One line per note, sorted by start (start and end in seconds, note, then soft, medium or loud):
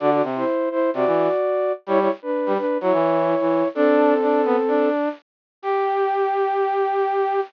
0.00 0.22 D3 loud
0.00 0.10 F#4 medium
0.00 0.10 D5 medium
0.11 0.23 F#4 medium
0.11 0.23 D5 medium
0.23 0.44 C3 loud
0.36 0.69 E4 medium
0.36 0.69 C5 medium
0.71 0.90 E4 medium
0.71 0.90 C5 medium
0.94 1.05 C3 loud
0.94 1.72 F#4 medium
0.94 1.72 D5 medium
1.06 1.28 E3 loud
1.87 2.08 G3 loud
1.87 1.99 E4 medium
1.87 1.99 C#5 loud
2.00 2.11 E4 medium
2.00 2.11 C#5 medium
2.22 2.53 D4 medium
2.22 2.53 B4 medium
2.46 2.58 G3 loud
2.57 2.78 D4 medium
2.57 2.78 B4 medium
2.81 2.92 F#3 loud
2.81 3.68 E4 medium
2.81 3.68 C#5 medium
2.93 3.35 E3 loud
3.41 3.63 E3 medium
3.75 4.89 C4 medium
3.75 4.14 D4 loud
3.75 4.89 A4 medium
4.22 4.41 D4 medium
4.45 4.56 B3 loud
4.68 5.09 D4 medium
5.62 7.40 G4 loud